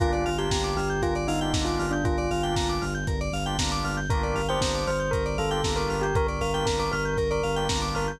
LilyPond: <<
  \new Staff \with { instrumentName = "Tubular Bells" } { \time 4/4 \key g \minor \tempo 4 = 117 f'8. g'8. g'8 f'16 r16 ees'8. f'8 d'16 | f'4. r2 r8 | bes'8. c''8. c''8 bes'16 r16 a'8. bes'8 g'16 | bes'16 bes'16 bes'8 bes'16 bes'16 bes'8 bes'16 bes'8. r8 bes'16 r16 | }
  \new Staff \with { instrumentName = "Drawbar Organ" } { \time 4/4 \key g \minor <bes d' f' g'>8. <bes d' f' g'>2 <bes d' f' g'>16 <bes d' f' g'>4~ | <bes d' f' g'>8. <bes d' f' g'>2 <bes d' f' g'>16 <bes d' f' g'>4 | <bes d' f' g'>8. <bes d' f' g'>2 <bes d' f' g'>16 <bes d' f' g'>4~ | <bes d' f' g'>8. <bes d' f' g'>2 <bes d' f' g'>16 <bes d' f' g'>4 | }
  \new Staff \with { instrumentName = "Electric Piano 2" } { \time 4/4 \key g \minor bes'16 d''16 f''16 g''16 bes''16 d'''16 f'''16 g'''16 bes'16 d''16 f''16 g''16 bes''16 d'''16 f'''16 g'''16 | bes'16 d''16 f''16 g''16 bes''16 d'''16 f'''16 g'''16 bes'16 d''16 f''16 g''16 bes''16 d'''16 f'''16 g'''16 | bes'16 d''16 f''16 g''16 bes''16 d'''16 f'''16 g'''16 bes'16 d''16 f''16 g''16 bes''16 d'''16 f'''16 g'''16 | bes'16 d''16 f''16 g''16 bes''16 d'''16 f'''16 g'''16 bes'16 d''16 f''16 g''16 bes''16 d'''16 f'''16 g'''16 | }
  \new Staff \with { instrumentName = "Synth Bass 2" } { \clef bass \time 4/4 \key g \minor g,,8 g,,8 g,,8 g,,8 g,,8 g,,8 g,,8 g,,8 | g,,8 g,,8 g,,8 g,,8 g,,8 g,,8 g,,8 g,,8 | g,,8 g,,8 g,,8 g,,8 g,,8 g,,8 g,,8 g,,8 | g,,8 g,,8 g,,8 g,,8 g,,8 g,,8 g,,8 g,,8 | }
  \new DrumStaff \with { instrumentName = "Drums" } \drummode { \time 4/4 <hh bd>16 hh16 hho16 hh16 <bd sn>16 hh16 hho16 hh16 <hh bd>16 hh16 hho16 hh16 <bd sn>16 hh16 hho16 hh16 | <hh bd>16 hh16 hho16 hh16 <bd sn>16 hh16 hho16 hh16 <hh bd>16 hh16 hho16 hh16 <bd sn>16 hh16 hho16 hh16 | <hh bd>16 hh16 hho16 hh16 <bd sn>16 hh16 hho16 hh16 <hh bd>16 hh16 hho16 hh16 <bd sn>16 hh16 hho16 hh16 | <hh bd>16 hh16 hho16 hh16 <bd sn>16 hh16 hho16 hh16 <hh bd>16 hh16 hho16 hh16 <bd sn>16 hh16 hho16 hh16 | }
>>